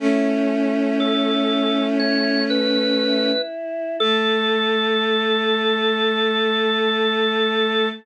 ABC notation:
X:1
M:4/4
L:1/8
Q:1/4=60
K:A
V:1 name="Drawbar Organ"
z2 A2 c B2 z | A8 |]
V:2 name="Choir Aahs"
[CE]6 E2 | A8 |]
V:3 name="Violin"
[A,C]8 | A,8 |]